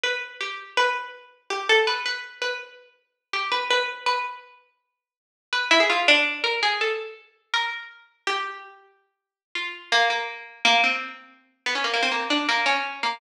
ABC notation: X:1
M:9/8
L:1/16
Q:3/8=109
K:none
V:1 name="Harpsichord"
B4 G4 B8 G2 | A2 B2 B4 B2 z8 | G2 B2 B4 B6 z4 | z6 B2 E ^G F2 D4 ^A2 |
^G2 A4 z4 ^A2 z6 | G10 z4 F4 | ^A,2 A,6 A,2 C6 z2 | z B, ^C ^A, A, =C A,2 D2 A,2 ^C4 A,2 |]